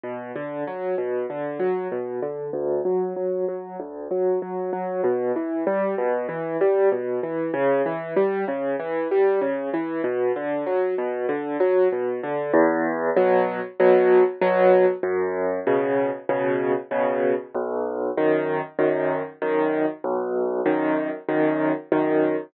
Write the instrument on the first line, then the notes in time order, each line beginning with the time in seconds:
acoustic grand piano
0.04 B2
0.36 D3
0.67 F#3
0.98 B2
1.30 D3
1.60 F#3
1.92 B2
2.23 D3
2.53 D2
2.85 F#3
3.16 F#3
3.48 F#3
3.80 D2
4.11 F#3
4.42 F#3
4.73 F#3
5.04 B2
5.36 E3
5.67 G3
5.98 B2
6.29 E3
6.61 G3
6.92 B2
7.23 E3
7.54 C#3
7.86 E3
8.16 G3
8.48 C#3
8.80 E3
9.11 G3
9.41 C#3
9.74 E3
10.04 B2
10.36 D3
10.66 F#3
10.98 B2
11.29 D3
11.60 F#3
11.92 B2
12.23 D3
12.54 E2
13.17 B2 F#3
13.80 B2 F#3
14.42 B2 F#3
15.03 F#2
15.67 B2 C#3
16.29 B2 C#3
16.91 B2 C#3
17.55 B1
18.17 F#2 D#3
18.79 F#2 D#3
19.42 F#2 D#3
20.04 B1
20.66 F#2 D#3
21.29 F#2 D#3
21.92 F#2 D#3